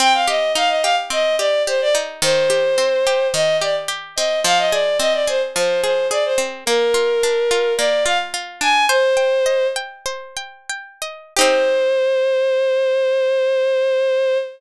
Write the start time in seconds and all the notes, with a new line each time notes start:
0.00 C4 G5
0.14 F5
0.28 G4 D#5
0.55 D#4 F5
0.69 D#5
0.82 G4 F5
1.10 C4 D#5
1.39 G4 D5
1.67 G4 C5
1.81 D5
1.95 D#4
2.22 D#3 C5
2.50 G4
2.78 C4
3.07 G4
3.34 D#3 D#5
3.61 G4 D5
3.88 G4
4.16 C4 D#5
4.44 F3 F5
4.58 D#5
4.72 G#4 D5
5.00 C4 D#5
5.14 D5
5.27 G#4 C5
5.55 F3 C5
5.84 G#4 C5
6.11 G#4 D5
6.25 C5
6.38 C4
6.66 A#3 A#4
6.94 F4
7.23 D4
7.51 F4
7.78 A#3 D5
8.05 F4 F5
8.34 F4
8.61 D4 G#5
8.89 C5
9.17 G5
9.46 D#5
9.76 G5
10.06 C5
10.37 G5
10.70 G5
11.02 D#5
11.37 D#4 G4 C5
11.41 C4